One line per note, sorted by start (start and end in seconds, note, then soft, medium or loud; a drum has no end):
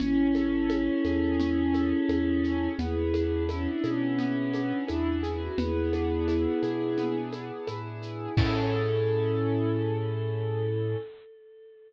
0.00 0.90 A1 medium
0.00 0.69 C#4 loud
0.00 2.68 C#4 loud
0.00 2.68 E4 loud
0.00 low conga medium
0.00 shaker medium
0.35 1.73 A4 medium
0.35 high conga medium
0.35 shaker medium
0.70 1.39 C#4 medium
0.70 high conga medium
0.70 shaker medium
1.04 1.93 E2 medium
1.04 2.09 G#4 medium
1.04 high conga medium
1.04 shaker medium
1.40 2.43 C#4 medium
1.40 low conga medium
1.40 shaker medium
1.73 2.73 A4 medium
1.73 high conga medium
1.73 shaker medium
2.09 2.68 E2 medium
2.09 2.76 G#4 medium
2.09 high conga medium
2.09 shaker medium
2.44 2.77 C#4 medium
2.44 shaker medium
2.78 3.67 E2 medium
2.78 4.19 B3 medium
2.78 3.44 E4 loud
2.78 3.44 G#4 loud
2.78 low conga medium
2.78 shaker medium
3.13 4.53 D4 medium
3.13 high conga medium
3.13 shaker medium
3.49 3.67 C#4 loud
3.49 4.88 E4 medium
3.49 high conga medium
3.49 shaker medium
3.66 3.83 D4 loud
3.82 4.73 B2 medium
3.82 4.81 C#4 loud
3.82 5.22 G#4 medium
3.82 high conga medium
3.82 shaker medium
4.19 5.52 B3 medium
4.19 low conga medium
4.19 shaker medium
4.53 5.53 D4 medium
4.53 high conga medium
4.53 shaker medium
4.88 5.49 E2 medium
4.88 5.20 D4 loud
4.88 5.54 E4 medium
4.88 high conga medium
4.88 shaker medium
5.23 5.40 E4 loud
5.23 5.56 G#4 medium
5.23 shaker medium
5.41 5.58 F#4 loud
5.57 6.47 E2 medium
5.57 6.98 B3 loud
5.57 7.16 E4 loud
5.57 7.16 G#4 loud
5.57 low conga medium
5.57 shaker medium
5.93 7.32 D4 medium
5.93 high conga medium
5.93 shaker medium
6.27 7.67 E4 medium
6.27 high conga medium
6.27 shaker medium
6.62 7.51 B2 medium
6.62 8.01 G#4 medium
6.62 high conga medium
6.62 shaker medium
6.98 8.31 B3 medium
6.98 low conga medium
6.98 shaker medium
7.32 8.32 D4 medium
7.32 high conga medium
7.32 shaker medium
7.67 8.27 A2 medium
7.67 8.34 E4 medium
7.67 high conga medium
7.67 shaker medium
8.02 8.35 G#4 medium
8.02 shaker medium
8.37 10.95 A2 loud
8.37 10.96 C#4 medium
8.37 10.96 E4 medium
8.37 10.96 G#4 loud
8.37 10.96 A4 loud
8.37 10.97 A4 loud
8.37 kick loud
8.37 crash loud